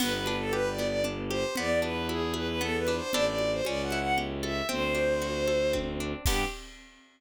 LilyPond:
<<
  \new Staff \with { instrumentName = "Violin" } { \time 3/4 \key g \major \tempo 4 = 115 b'16 b'8 a'16 \tuplet 3/2 { b'8 d''8 d''8 } r8 c''8 | d''8 b'8 gis'8 b'16 b'16 \tuplet 3/2 { a'8 b'8 c''8 } | d''16 d''8 c''16 \tuplet 3/2 { d''8 fis''8 fis''8 } r8 e''8 | c''2 r4 |
g'4 r2 | }
  \new Staff \with { instrumentName = "Orchestral Harp" } { \time 3/4 \key g \major b8 d'8 g'8 b8 d'8 g'8 | b8 d'8 e'8 gis'8 b8 d'8 | <d' e' g' a'>4 cis'8 e'8 g'8 a'8 | c'8 d'8 fis'8 a'8 c'8 d'8 |
<b d' g'>4 r2 | }
  \new Staff \with { instrumentName = "Violin" } { \clef bass \time 3/4 \key g \major g,,2. | e,2. | a,,4 cis,2 | d,2. |
g,4 r2 | }
  \new DrumStaff \with { instrumentName = "Drums" } \drummode { \time 3/4 <cgl cymc>8 cgho8 cgho8 cgho8 cgl8 cgho8 | cgl8 cgho8 cgho8 cgho8 cgl8 cgho8 | cgl8 cgho8 cgho8 cgho8 cgl8 cgho8 | cgl8 cgho8 cgho8 cgho8 <bd tommh>4 |
<cymc bd>4 r4 r4 | }
>>